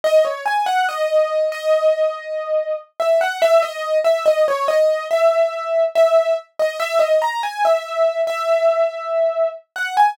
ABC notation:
X:1
M:4/4
L:1/16
Q:1/4=71
K:G#m
V:1 name="Acoustic Grand Piano"
d c g f d3 d7 e f | e d2 e d c d2 e4 e2 z d | e d a g e3 e7 f g |]